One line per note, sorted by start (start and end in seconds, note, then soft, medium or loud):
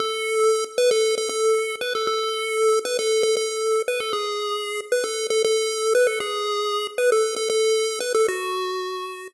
0.00 0.64 A4 loud
0.78 0.90 B4 loud
0.91 1.15 A4 loud
1.18 1.29 A4 medium
1.29 1.76 A4 medium
1.81 1.93 B4 loud
1.95 2.07 A4 medium
2.07 2.79 A4 loud
2.85 2.97 B4 loud
2.99 3.23 A4 medium
3.23 3.35 A4 loud
3.37 3.82 A4 medium
3.88 4.00 B4 medium
4.00 4.12 A4 medium
4.13 4.81 G#4 medium
4.92 5.04 B4 medium
5.04 5.27 A4 medium
5.30 5.43 A4 medium
5.45 5.94 A4 loud
5.95 6.07 B4 loud
6.07 6.19 A4 medium
6.20 6.87 G#4 loud
6.98 7.10 B4 loud
7.12 7.35 A4 medium
7.36 7.49 A4 medium
7.50 7.99 A4 loud
8.00 8.13 B4 medium
8.15 8.27 A4 loud
8.28 9.28 F#4 loud